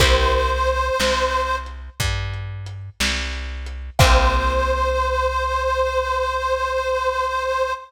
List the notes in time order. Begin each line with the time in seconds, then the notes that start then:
0.00 C2 A#3 C4 E4 G4 C5, kick, closed hi-hat
0.33 closed hi-hat
0.67 closed hi-hat
1.00 C2, snare
1.33 closed hi-hat
1.66 closed hi-hat
2.00 G2, kick, closed hi-hat
2.34 closed hi-hat
2.66 closed hi-hat
3.00 C2, snare
3.33 closed hi-hat
3.66 closed hi-hat
3.99 C2 A#3 C4 E4 G4 C5, kick, crash